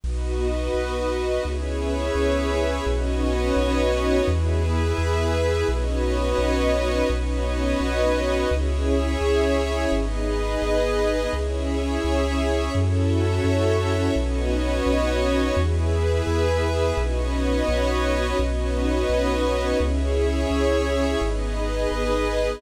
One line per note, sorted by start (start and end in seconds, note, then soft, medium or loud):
0.04 0.69 B1 loud
0.04 1.44 B3 medium
0.04 1.44 D#4 medium
0.04 1.43 F#4 medium
0.04 1.44 F#4 medium
0.04 1.43 B4 medium
0.04 1.43 D#5 medium
0.74 1.39 B1 medium
1.45 2.10 C#2 medium
1.45 2.85 B3 medium
1.45 2.85 C#4 medium
1.45 2.85 E4 medium
1.45 2.85 G#4 medium
1.45 2.85 B4 medium
1.45 2.85 C#5 medium
1.45 2.85 E5 medium
2.15 2.80 C#2 medium
2.86 3.51 B1 loud
2.86 4.26 B3 medium
2.86 4.26 C#4 loud
2.86 4.26 D#4 medium
2.86 4.26 F#4 loud
2.86 4.26 F#4 medium
2.86 4.26 B4 medium
2.86 4.26 C#5 medium
2.86 4.26 D#5 medium
3.56 4.21 B1 loud
4.26 4.92 E2 loud
4.26 5.66 B3 medium
4.26 5.66 E4 medium
4.26 5.66 G#4 medium
4.26 5.67 G#4 medium
4.26 5.67 B4 medium
4.26 5.67 E5 medium
4.98 5.63 E2 loud
5.68 6.34 B1 loud
5.68 7.08 B3 medium
5.68 7.08 C#4 medium
5.68 7.08 D#4 medium
5.68 7.08 F#4 medium
5.68 7.08 B4 medium
5.68 7.08 C#5 medium
5.68 7.08 D#5 medium
6.38 7.03 B1 loud
7.10 7.75 B1 loud
7.10 8.49 B3 medium
7.10 8.49 C#4 medium
7.10 8.49 D#4 medium
7.10 8.49 F#4 medium
7.10 8.49 B4 medium
7.10 8.49 C#5 medium
7.10 8.49 D#5 medium
7.80 8.45 B1 loud
8.50 9.16 C#2 loud
8.50 9.90 C#4 loud
8.50 9.90 E4 medium
8.50 9.90 G#4 medium
8.50 9.90 G#4 loud
8.50 9.90 C#5 medium
8.50 9.90 E5 medium
9.21 9.86 C#2 loud
9.92 10.57 G#1 loud
9.92 11.32 B3 medium
9.92 11.32 D#4 medium
9.92 11.31 G#4 medium
9.92 11.32 G#4 medium
9.92 11.31 B4 medium
9.92 11.31 D#5 medium
10.62 11.27 G#1 medium
11.33 11.98 C#2 loud
11.33 12.73 C#4 medium
11.33 12.73 E4 medium
11.33 12.72 G#4 medium
11.33 12.73 G#4 medium
11.33 12.72 C#5 medium
11.33 12.72 E5 medium
12.04 12.69 C#2 loud
12.74 13.40 F#2 loud
12.74 14.14 C#4 loud
12.74 14.14 E4 medium
12.74 14.14 F#4 medium
12.74 14.14 A4 medium
12.74 14.14 C#5 medium
12.74 14.14 E5 medium
13.44 14.09 F#2 loud
14.15 14.81 B1 loud
14.15 15.55 B3 medium
14.15 15.55 C#4 loud
14.15 15.55 D#4 medium
14.15 15.55 F#4 loud
14.15 15.55 F#4 medium
14.15 15.55 B4 medium
14.15 15.55 C#5 medium
14.15 15.55 D#5 medium
14.86 15.51 B1 loud
15.56 16.21 E2 loud
15.56 16.96 B3 medium
15.56 16.96 E4 medium
15.56 16.96 G#4 medium
15.56 16.96 B4 medium
15.56 16.96 E5 medium
16.27 16.92 E2 loud
16.97 17.62 B1 loud
16.97 18.37 B3 medium
16.97 18.37 C#4 medium
16.97 18.37 D#4 medium
16.97 18.37 F#4 medium
16.97 18.37 B4 medium
16.97 18.37 C#5 medium
16.97 18.37 D#5 medium
17.68 18.33 B1 loud
18.39 19.04 B1 loud
18.39 19.80 B3 medium
18.39 19.79 C#4 medium
18.39 19.80 D#4 medium
18.39 19.78 F#4 medium
18.39 19.80 F#4 medium
18.39 19.78 B4 medium
18.39 19.78 C#5 medium
18.39 19.78 D#5 medium
19.09 19.74 B1 loud
19.79 20.45 C#2 loud
19.79 21.19 C#4 loud
19.79 21.19 E4 medium
19.79 21.19 G#4 loud
19.79 21.20 G#4 medium
19.79 21.20 C#5 medium
19.79 21.20 E5 medium
20.50 21.15 C#2 loud
21.21 21.86 G#1 loud
21.21 22.61 B3 medium
21.21 22.61 D#4 medium
21.21 22.61 G#4 medium
21.21 22.61 B4 medium
21.21 22.61 D#5 medium
21.91 22.56 G#1 medium